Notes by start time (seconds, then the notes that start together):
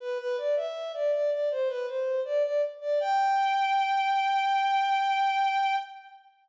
0.00 B4
0.18 B4
0.38 D5
0.56 E5
0.94 D5
1.12 D5
1.31 D5
1.51 C5
1.68 B4
1.87 C5
2.25 D5
2.44 D5
2.81 D5
3.00 G5